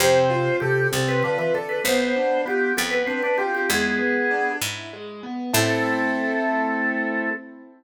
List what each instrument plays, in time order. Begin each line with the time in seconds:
0.00 harpsichord F2, drawbar organ C3 C5, acoustic grand piano C4
0.30 acoustic grand piano F4
0.60 drawbar organ C3 G4, acoustic grand piano A4
0.92 harpsichord C2, drawbar organ C3 A4, acoustic grand piano C4
1.08 drawbar organ B4
1.23 drawbar organ D3 B4, acoustic grand piano F4
1.38 drawbar organ E3 B4
1.54 drawbar organ D3 A4, acoustic grand piano A4
1.69 drawbar organ B4
1.84 harpsichord B1, drawbar organ B3 C5, acoustic grand piano B3
2.16 acoustic grand piano D4
2.45 drawbar organ B3 G4, acoustic grand piano F4
2.77 harpsichord F2, acoustic grand piano B3, drawbar organ B3 A4
2.91 drawbar organ B4
3.07 drawbar organ C4 B4, acoustic grand piano D4
3.23 drawbar organ D4 B4
3.38 drawbar organ C4 G4, acoustic grand piano F4
3.55 drawbar organ G4
3.69 harpsichord E2, acoustic grand piano G#3, drawbar organ B3 G#4
3.99 acoustic grand piano B3
4.31 acoustic grand piano D4
4.61 harpsichord G#2, acoustic grand piano E4
4.93 acoustic grand piano G#3
5.23 acoustic grand piano B3
5.53 harpsichord A2, drawbar organ A3 A4, acoustic grand piano C4 E4 A4